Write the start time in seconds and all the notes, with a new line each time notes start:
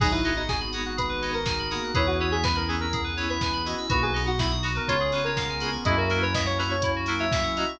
0.00 G#1 F#3 B3 D#4 F#4 G#4, kick, crash
0.12 E4 B4
0.24 B3 D#4 F#4 G#4 D#5, open hi-hat
0.36 D#4 F#5
0.48 G#4 G#5, kick, snare
0.60 B5
0.72 B3 D#4 F#4 G#4 D#6, open hi-hat
0.86 F#4 F#6
0.97 G#4 B4, kick, closed hi-hat
1.09 B4
1.22 B3 D#4 F#4 G#4 D#5, open hi-hat
1.33 A#4 F#5
1.46 G#5, kick, snare
1.59 B5
1.71 A#3 B3 D#4 F#4 G#4 D#6, open hi-hat
1.84 F#6
1.94 E2 B3 C#4 E4 G#4 B4 C#5, kick, closed hi-hat
2.07 F#4 B4
2.20 B3 C#4 E4 G#4 C#5
2.32 G#4 E5
2.43 B4 G#5, kick, snare
2.55 A#4 B5
2.68 B3 C#4 E4 G#4 C#6, open hi-hat
2.80 A#4 E6
2.93 G#4, kick, closed hi-hat
3.04 B4
3.17 B3 C#4 E4 G#4 C#5, open hi-hat
3.29 B4 E5
3.41 G#5, kick, snare
3.53 B5
3.66 B3 C#4 E4 F#4 G#4 D#5 C#6, open hi-hat
3.78 E6
3.89 B1 A#3 B3 D#4 F#4 B4, kick, closed hi-hat
4.02 G#4 B4
4.14 B3 D#4 F#4 D#5, open hi-hat
4.27 F#4 F#5
4.39 E4 B5, kick, snare
4.51 D#6
4.63 B3 D#4 F#4, open hi-hat
4.75 A#4 B4
4.88 C#2 B3 C#4 F4 G#4 C#5, kick, closed hi-hat
5.00 G#4
5.12 B3 C#4 F4 G#4 B4, open hi-hat
5.24 A#4 C#5
5.36 F5, kick, snare
5.49 G#5
5.60 B3 C#4 F4 G#4 B5, open hi-hat
5.72 C#6
5.84 F#2 A#3 C#4 E4 F#4 G#4 D#5 E5, kick, closed hi-hat
5.97 F#4 A#4
6.10 A#3 C#4 E4 F#4 A#4, open hi-hat
6.22 B4 C#5
6.34 D#5 E5, kick, snare
6.46 C#5 F#5
6.58 A#3 C#4 E4 F#4 B4 A#5, open hi-hat
6.70 C#5 C#6
6.82 E4, kick, closed hi-hat
6.96 F#4
7.06 A#3 C#4 E4 F#4 A#4, open hi-hat
7.20 C#5 E5
7.32 E5, kick, snare
7.43 F#5
7.56 A#3 C#4 E4 F#4 D#5 A#5, open hi-hat
7.69 C#6